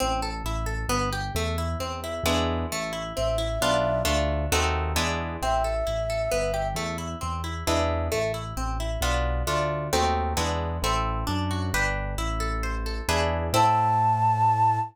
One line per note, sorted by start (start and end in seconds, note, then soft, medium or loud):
0.00 0.42 A1 medium
0.00 0.20 C4 medium
0.22 0.43 A4 medium
0.44 0.85 A1 medium
0.44 0.66 E4 medium
0.66 0.87 A4 medium
0.89 1.30 G1 medium
0.89 1.10 B3 loud
1.13 1.33 G4 medium
1.35 1.75 E2 medium
1.35 1.56 A3 medium
1.58 1.78 E4 medium
1.80 2.20 E2 medium
1.80 2.00 C4 medium
2.04 2.24 E4 medium
2.24 2.65 E2 medium
2.24 2.66 G#3 medium
2.24 2.66 B3 medium
2.24 2.66 D4 medium
2.24 2.66 E4 medium
2.72 3.12 A1 medium
2.72 2.92 A3 medium
2.93 3.13 E4 medium
3.16 3.58 A1 medium
3.16 3.37 C4 medium
3.16 4.01 E5 medium
3.38 3.58 E4 medium
3.61 4.03 B1 medium
3.61 4.03 B3 medium
3.61 4.03 D4 medium
3.61 4.03 F4 medium
4.05 4.47 D2 medium
4.05 4.46 A3 medium
4.05 4.46 D4 medium
4.05 4.46 F4 medium
4.52 4.94 D#2 medium
4.52 4.93 A3 medium
4.52 4.93 C4 medium
4.52 4.93 D#4 medium
4.52 4.93 F#4 medium
4.95 5.37 E2 medium
4.95 5.37 G#3 medium
4.95 5.37 B3 medium
4.95 5.37 D4 medium
4.95 5.37 E4 medium
5.42 5.83 A1 medium
5.42 5.63 C4 medium
5.42 6.68 E5 medium
5.64 5.85 A4 medium
5.87 6.28 A1 medium
5.87 6.07 E4 medium
6.10 6.30 A4 medium
6.31 6.74 G1 medium
6.31 6.52 B3 medium
6.54 6.74 G4 medium
6.75 7.15 E2 medium
6.75 6.97 A3 medium
6.98 7.18 E4 medium
7.21 7.63 E2 medium
7.21 7.41 C4 medium
7.44 7.64 E4 medium
7.67 8.09 E2 medium
7.67 8.08 G#3 medium
7.67 8.08 B3 medium
7.67 8.08 D4 medium
7.67 8.08 E4 medium
8.12 8.53 A1 medium
8.12 8.32 A3 medium
8.34 8.54 E4 medium
8.57 8.97 A1 medium
8.57 8.77 C4 medium
8.80 9.00 E4 medium
9.01 9.43 B1 medium
9.01 9.43 B3 medium
9.01 9.43 D4 medium
9.01 9.43 F4 medium
9.47 9.89 D2 medium
9.47 9.88 A3 medium
9.47 9.88 D4 medium
9.47 9.88 F4 medium
9.93 10.34 D#2 medium
9.93 10.33 A3 medium
9.93 10.33 C4 medium
9.93 10.33 D#4 medium
9.93 10.33 F#4 medium
10.37 10.79 E2 medium
10.37 10.77 G#3 medium
10.37 10.77 B3 medium
10.37 10.77 D4 medium
10.37 10.77 E4 medium
10.82 11.24 A1 loud
10.82 11.24 C4 medium
10.82 11.24 E4 medium
10.82 11.24 A4 medium
11.27 11.70 F#2 loud
11.27 11.70 D4 medium
11.51 11.72 F#4 medium
11.74 12.15 G1 medium
11.74 12.15 D4 medium
11.74 12.15 G4 medium
11.74 12.15 B4 medium
12.18 13.01 A1 medium
12.18 13.04 E4 medium
12.40 12.86 A4 medium
12.63 13.06 C5 medium
12.86 13.08 A4 medium
13.08 13.50 E2 loud
13.08 13.49 D4 medium
13.08 13.49 E4 medium
13.08 13.49 G#4 medium
13.08 13.49 B4 medium
13.53 14.79 A2 loud
13.53 14.80 C4 medium
13.53 14.80 E4 medium
13.53 14.80 A4 loud
13.53 14.79 A5 loud